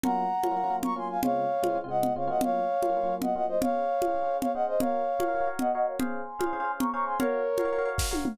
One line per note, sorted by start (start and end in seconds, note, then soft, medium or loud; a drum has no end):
0.04 0.26 F#3 medium
0.04 0.26 A#3 medium
0.04 0.26 C#4 medium
0.04 0.26 F4 medium
0.04 0.76 F#5 medium
0.04 0.76 A#5 medium
0.04 low conga medium
0.43 0.49 F#3 medium
0.43 0.49 A#3 medium
0.43 0.49 C#4 medium
0.43 0.49 F4 medium
0.43 high conga medium
0.51 0.56 F#3 medium
0.51 0.56 A#3 medium
0.51 0.56 C#4 medium
0.51 0.56 F4 medium
0.57 0.62 F#3 medium
0.57 0.62 A#3 medium
0.57 0.62 C#4 medium
0.57 0.62 F4 medium
0.64 0.69 F#3 medium
0.64 0.69 A#3 medium
0.64 0.69 C#4 medium
0.64 0.69 F4 medium
0.70 0.91 F#3 medium
0.70 0.91 A#3 medium
0.70 0.91 C#4 medium
0.70 0.91 F4 medium
0.83 0.94 A#5 medium
0.83 0.94 C#6 medium
0.83 low conga medium
0.96 1.17 F#3 medium
0.96 1.17 A#3 medium
0.96 1.17 C#4 medium
0.96 1.17 F4 medium
0.96 1.08 G#5 medium
0.96 1.08 C6 medium
1.10 1.21 F5 medium
1.10 1.21 G#5 medium
1.23 1.45 C#3 medium
1.23 1.45 G#3 medium
1.23 1.45 C4 medium
1.23 1.45 F4 medium
1.23 1.78 C#5 medium
1.23 1.78 F5 medium
1.23 low conga medium
1.63 1.68 C#3 medium
1.63 1.68 G#3 medium
1.63 1.68 C4 medium
1.63 1.68 F4 medium
1.63 high conga medium
1.70 1.75 C#3 medium
1.70 1.75 G#3 medium
1.70 1.75 C4 medium
1.70 1.75 F4 medium
1.75 1.81 C#3 medium
1.75 1.81 G#3 medium
1.75 1.81 C4 medium
1.75 1.81 F4 medium
1.84 1.88 C#3 medium
1.84 1.88 G#3 medium
1.84 1.88 C4 medium
1.84 1.88 F4 medium
1.89 2.10 C#3 medium
1.89 2.10 G#3 medium
1.89 2.10 C4 medium
1.89 2.10 F4 medium
1.89 2.13 D#5 medium
1.89 2.13 F#5 medium
2.03 low conga medium
2.16 2.29 C#3 medium
2.16 2.29 G#3 medium
2.16 2.29 C4 medium
2.16 2.27 F4 medium
2.16 2.28 C#5 medium
2.16 2.28 F5 medium
2.27 2.62 F#3 medium
2.27 2.62 A#3 medium
2.27 2.62 C#4 medium
2.27 2.62 F4 medium
2.27 2.41 D#5 medium
2.27 2.41 F#5 medium
2.41 3.15 C#5 medium
2.41 3.15 F5 loud
2.41 low conga medium
2.83 2.88 F#3 medium
2.83 2.88 A#3 medium
2.83 2.88 C#4 medium
2.83 2.88 F4 medium
2.83 high conga medium
2.89 2.95 F#3 medium
2.89 2.95 A#3 medium
2.89 2.95 C#4 medium
2.89 2.95 F4 medium
2.97 3.02 F#3 medium
2.97 3.02 A#3 medium
2.97 3.02 C#4 medium
2.97 3.02 F4 medium
3.03 3.08 F#3 medium
3.03 3.08 A#3 medium
3.03 3.08 C#4 medium
3.03 3.08 F4 medium
3.09 3.30 F#3 medium
3.09 3.30 A#3 medium
3.09 3.30 C#4 medium
3.09 3.30 F4 medium
3.22 3.34 D#5 medium
3.22 3.34 F#5 medium
3.22 low conga medium
3.35 3.57 F#3 medium
3.35 3.57 A#3 medium
3.35 3.57 C#4 medium
3.35 3.57 F4 medium
3.35 3.46 D#5 medium
3.35 3.46 F#5 medium
3.48 3.59 C5 medium
3.48 3.59 D#5 medium
3.61 3.84 C#4 medium
3.61 3.84 G#4 medium
3.61 3.84 C5 medium
3.61 4.37 C#5 medium
3.61 4.37 F5 loud
3.61 3.84 F5 medium
3.61 low conga loud
4.02 4.07 C#4 medium
4.02 4.07 G#4 medium
4.02 4.07 C5 medium
4.02 4.07 F5 medium
4.02 high conga medium
4.08 4.13 C#4 medium
4.08 4.13 G#4 medium
4.08 4.13 C5 medium
4.08 4.13 F5 medium
4.15 4.20 C#4 medium
4.15 4.20 G#4 medium
4.15 4.20 C5 medium
4.15 4.20 F5 medium
4.22 4.26 C#4 medium
4.22 4.26 G#4 medium
4.22 4.26 C5 medium
4.22 4.26 F5 medium
4.27 4.48 C#4 medium
4.27 4.48 G#4 medium
4.27 4.48 C5 medium
4.27 4.48 F5 medium
4.41 4.52 C#5 medium
4.41 4.52 F5 medium
4.41 low conga medium
4.54 4.76 C#4 medium
4.54 4.76 G#4 medium
4.54 4.76 C5 medium
4.54 4.65 D#5 medium
4.54 4.76 F5 medium
4.54 4.65 F#5 medium
4.67 4.79 C5 medium
4.67 4.79 D#5 medium
4.80 5.02 F#4 medium
4.80 5.02 A#4 loud
4.80 5.48 C#5 medium
4.80 5.02 C#5 medium
4.80 5.48 F5 medium
4.80 5.02 F5 medium
4.80 low conga loud
5.19 5.25 F#4 medium
5.19 5.25 A#4 medium
5.19 5.25 C#5 medium
5.19 5.25 F5 medium
5.19 high conga medium
5.28 5.33 F#4 medium
5.28 5.33 A#4 medium
5.28 5.33 C#5 medium
5.28 5.33 F5 medium
5.35 5.40 F#4 medium
5.35 5.40 A#4 medium
5.35 5.40 C#5 medium
5.35 5.40 F5 medium
5.41 5.46 F#4 medium
5.41 5.46 A#4 medium
5.41 5.46 C#5 medium
5.41 5.46 F5 medium
5.47 5.68 F#4 medium
5.47 5.68 A#4 medium
5.47 5.68 C#5 medium
5.47 5.68 F5 medium
5.59 5.72 D#5 medium
5.59 5.72 F#5 medium
5.59 low conga medium
5.73 5.96 F#4 medium
5.73 5.96 A#4 medium
5.73 5.96 C#5 medium
5.73 5.86 D#5 medium
5.73 5.96 F5 medium
5.73 5.86 F#5 medium
5.87 5.98 C#5 medium
5.87 5.98 F5 medium
6.00 6.21 C#4 medium
6.00 6.21 G#4 medium
6.00 6.21 C5 medium
6.00 6.21 F5 medium
6.00 6.72 G#5 medium
6.00 6.72 C6 loud
6.00 low conga medium
6.39 6.45 C#4 medium
6.39 6.45 G#4 medium
6.39 6.45 C5 medium
6.39 6.45 F5 medium
6.39 high conga medium
6.46 6.52 C#4 medium
6.46 6.52 G#4 medium
6.46 6.52 C5 medium
6.46 6.52 F5 medium
6.53 6.58 C#4 medium
6.53 6.58 G#4 medium
6.53 6.58 C5 medium
6.53 6.58 F5 medium
6.60 6.64 C#4 medium
6.60 6.64 G#4 medium
6.60 6.64 C5 medium
6.60 6.64 F5 medium
6.65 6.86 C#4 medium
6.65 6.86 G#4 medium
6.65 6.86 C5 medium
6.65 6.86 F5 medium
6.79 6.90 A#5 medium
6.79 6.90 C#6 medium
6.79 low conga medium
6.93 7.15 C#4 medium
6.93 7.15 G#4 medium
6.93 7.15 C5 medium
6.93 7.15 F5 medium
6.93 7.05 A#5 medium
6.93 7.05 C#6 medium
7.06 7.18 G#5 medium
7.06 7.18 C6 medium
7.19 7.41 F#4 medium
7.19 7.89 A#4 medium
7.19 7.41 A#4 medium
7.19 7.89 C#5 medium
7.19 7.41 C#5 medium
7.19 7.41 F5 medium
7.19 low conga medium
7.58 7.64 F#4 medium
7.58 7.64 A#4 medium
7.58 7.64 C#5 medium
7.58 7.64 F5 medium
7.58 high conga medium
7.65 7.70 F#4 medium
7.65 7.70 A#4 medium
7.65 7.70 C#5 medium
7.65 7.70 F5 medium
7.73 7.78 F#4 medium
7.73 7.78 A#4 medium
7.73 7.78 C#5 medium
7.73 7.78 F5 medium
7.78 7.84 F#4 medium
7.78 7.84 A#4 medium
7.78 7.84 C#5 medium
7.78 7.84 F5 medium
7.85 8.07 F#4 medium
7.85 8.07 A#4 medium
7.85 8.07 C#5 medium
7.85 8.07 F5 medium
7.98 kick medium
7.98 snare medium
8.11 8.32 F#4 medium
8.11 8.32 A#4 medium
8.11 8.32 C#5 medium
8.11 8.32 F5 medium
8.11 high tom medium
8.25 mid tom loud